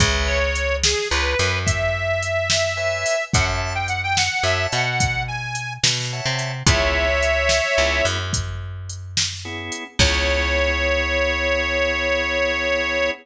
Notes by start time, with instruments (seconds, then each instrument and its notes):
0.00 electric bass (finger) C#2, drawbar organ B4 C#5 E5 G#5, kick, closed hi-hat
0.27 harmonica C#5
0.55 closed hi-hat
0.83 harmonica G#4, snare
1.10 electric bass (finger) C#2, harmonica B4
1.39 electric bass (finger) F#2, closed hi-hat
1.66 harmonica E5, kick, closed hi-hat
2.23 closed hi-hat
2.50 snare
2.77 drawbar organ B4 C#5 E5 G#5
3.06 open hi-hat
3.33 electric bass (finger) F#2, drawbar organ C#5 E5 F#5 A5, harmonica F#5, kick, closed hi-hat
3.75 harmonica G5
3.88 harmonica F#5, closed hi-hat
4.03 harmonica G5
4.17 harmonica F#5, snare
4.43 electric bass (finger) F#2, drawbar organ C#5 E5 F#5 A5, harmonica E5
4.72 electric bass (finger) B2, harmonica F#5, closed hi-hat
5.00 kick, closed hi-hat
5.28 harmonica G#5
5.55 closed hi-hat
5.83 electric bass (finger) B2, snare
6.13 drawbar organ C#5 E5 F#5 A5
6.26 electric bass (finger) C3
6.39 closed hi-hat
6.66 electric bass (finger) C#2, drawbar organ B3 C#4 E4 G#4, harmonica C#5 E5, kick, closed hi-hat
7.23 closed hi-hat
7.49 snare
7.78 electric bass (finger) C#2, drawbar organ B3 C#4 E4 G#4
8.05 electric bass (finger) F#2, closed hi-hat
8.33 kick, closed hi-hat
8.89 closed hi-hat
9.17 snare
9.45 drawbar organ B3 C#4 E4 G#4
9.72 closed hi-hat
9.99 electric bass (finger) C#2, drawbar organ B3 C#4 E4 G#4, harmonica C#5, kick, crash